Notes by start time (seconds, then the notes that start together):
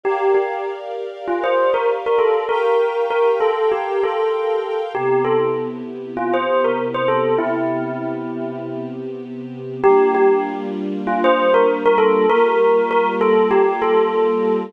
0.03 G4 A#4 D5 F5
0.35 G4
1.28 F4
1.44 C5
1.74 A#4
2.06 A#4
2.18 A4
2.49 G4 A#4 F5 G5
3.10 A#4
3.40 A4
3.72 G4
4.03 A4
4.94 C3 B3 E4 G4
5.24 A4
6.17 F4
6.34 C5
6.64 A#4
6.94 C5
7.08 A4
7.38 C3 B3 C4 E4 G4
9.83 G3 A#3 D4 F4 G4
10.15 G4
11.07 F4
11.24 C5
11.54 A#4
11.85 A#4
11.98 A4
12.29 G3 A#3 F4 G4 A#4
12.91 A#4
13.21 A4
13.51 G4
13.82 A4